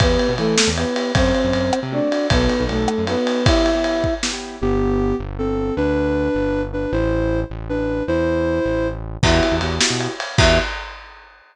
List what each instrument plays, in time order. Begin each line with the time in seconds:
0.00 synth bass 1 E2, acoustic grand piano B3 E4 G4, flute B3 B4, kick, ride
0.19 ride
0.29 synth bass 1 B2
0.38 synth bass 1 E3, flute A3 A4, ride
0.58 snare
0.67 synth bass 1 E2
0.77 acoustic grand piano B3 E4 G4, flute B3 B4, ride
0.96 acoustic grand piano B3 E4 G4, ride
1.15 synth bass 1 F#2, acoustic grand piano A3 C4 F#4, flute C4 C5, kick, ride
1.35 ride
1.44 synth bass 1 F#2
1.53 synth bass 1 F#2, ride
1.73 cross-stick
1.83 synth bass 1 C3
1.92 acoustic grand piano A3 C4 F#4, flute D4 D5
2.11 acoustic grand piano A3 C4 F#4, ride
2.30 synth bass 1 B1, acoustic grand piano B3 D#4 F#4 A4, flute B3 B4, kick, ride
2.49 ride
2.60 synth bass 1 B1, acoustic grand piano B3 D#4 F#4 A4
2.69 synth bass 1 B1, flute A3 A4, ride
2.88 cross-stick
2.98 synth bass 1 F#2
3.07 flute B3 B4, acoustic grand piano B3 D#4 F#4 A4, ride
3.17 acoustic grand piano B3 D#4 F#4 A4
3.27 ride
3.46 acoustic grand piano B3 E4 G4, flute E4 E5, kick, ride
3.66 ride
3.75 acoustic grand piano B3 E4 G4
3.84 ride
4.04 kick
4.23 acoustic grand piano B3 E4 G4, snare
4.33 acoustic grand piano B3 E4 G4
4.61 synth bass 1 G1, ocarina B3 G4
5.19 synth bass 1 G1
5.39 ocarina C4 A4
5.77 synth bass 1 D2, ocarina D4 B4
6.35 synth bass 1 G1
6.73 ocarina D4 B4
6.92 synth bass 1 A1, ocarina E4 C5
7.50 synth bass 1 A1
7.69 ocarina D4 B4
8.08 synth bass 1 E2, ocarina E4 C5
8.65 synth bass 1 A1
9.23 synth bass 1 E2, acoustic grand piano B3 E4 F#4 G4, flute E4 E5, kick, crash
9.43 ride
9.52 synth bass 1 E2, acoustic grand piano B3 E4 F#4 G4
9.61 synth bass 1 E2, acoustic grand piano B3 E4 F#4 G4, ride
9.81 acoustic grand piano B3 E4 F#4 G4, snare
9.90 synth bass 1 B2
10.00 ride
10.20 ride
10.38 synth bass 1 E2, acoustic grand piano B3 E4 F#4 G4, flute E5, kick, crash